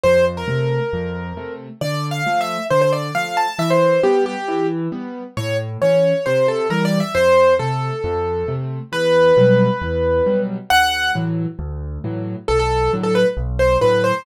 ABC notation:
X:1
M:4/4
L:1/16
Q:1/4=135
K:Dm
V:1 name="Acoustic Grand Piano"
c2 z B11 z2 | (3d4 f4 e4 c c d2 f2 a2 | e c3 G2 G4 z6 | ^c2 z2 c4 =c2 A2 (3B2 d2 e2 |
c4 A10 z2 | [K:Em] B16 | f4 z12 | A A3 z A B z3 c2 B2 c2 |]
V:2 name="Acoustic Grand Piano"
F,,4 [C,A,]4 F,,4 [C,A,]4 | D,4 [F,A,]4 D,4 [F,A,]4 | E,4 [G,=B,]4 E,4 [G,B,]4 | A,,4 [E,^C]4 =C,4 [E,G,]4 |
F,,4 [C,A,]4 F,,4 [C,A,]4 | [K:Em] E,,4 [B,,F,G,]4 E,,4 [B,,F,G,]4 | D,,4 [A,,E,F,]4 D,,4 [A,,E,F,]4 | B,,,4 [A,,D,F,]4 B,,,4 [A,,D,F,]4 |]